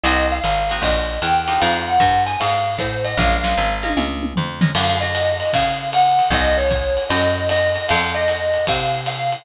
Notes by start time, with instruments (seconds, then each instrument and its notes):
0.04 electric bass (finger) C2, acoustic guitar (steel) A#3 C4 D#4 F#4, marimba D#5, ride
0.31 marimba F5
0.44 electric bass (finger) G#1, hi-hat pedal, ride
0.70 acoustic guitar (steel) A#3 C4 D#4 F#4, ride
0.82 electric bass (finger) A#1, marimba D#5, kick, ride
1.22 electric bass (finger) E2, marimba G5, hi-hat pedal, ride
1.48 acoustic guitar (steel) G#3 D#4 F4 G4, ride
1.60 electric bass (finger) F2, marimba F5, ride
1.88 marimba F#5
2.00 electric bass (finger) G2, kick, hi-hat pedal, ride
2.26 marimba G#5, ride
2.40 electric bass (finger) G#2, marimba F5, ride
2.78 electric bass (finger) A2, marimba C5, kick, hi-hat pedal, ride
3.04 marimba D#5, ride
3.17 electric bass (finger) A#1, acoustic guitar (steel) G#3 A#3 C#4 F4, marimba F5, kick, snare
3.44 acoustic guitar (steel) G#3 A#3 C#4 F4, snare
3.58 electric bass (finger) G#1
3.83 acoustic guitar (steel) G#3 A#3 C#4 F4, high tom
3.97 electric bass (finger) C#2, mid tom
4.23 mid tom
4.36 electric bass (finger) F2, floor tom
4.61 acoustic guitar (steel) G#3 A#3 C#4 F4, floor tom
4.75 electric bass (finger) F#2, marimba F5, crash, ride
5.01 marimba D#5
5.15 hi-hat pedal, ride
5.40 ride
5.53 electric bass (finger) C#3, marimba F5, kick, ride
5.92 marimba F#5, hi-hat pedal, ride
6.19 ride
6.30 electric bass (finger) C2, marimba D#5, kick, ride
6.58 marimba C#5
6.71 kick, hi-hat pedal, ride
6.97 ride
7.09 electric bass (finger) F#2, marimba D#5, ride
7.49 marimba D#5, hi-hat pedal, ride
7.76 ride
7.89 electric bass (finger) F2, marimba F5, ride
8.14 marimba D#5
8.28 hi-hat pedal, ride
8.54 ride
8.67 electric bass (finger) C3, marimba F5, kick, ride
9.06 marimba F5, hi-hat pedal, ride
9.32 ride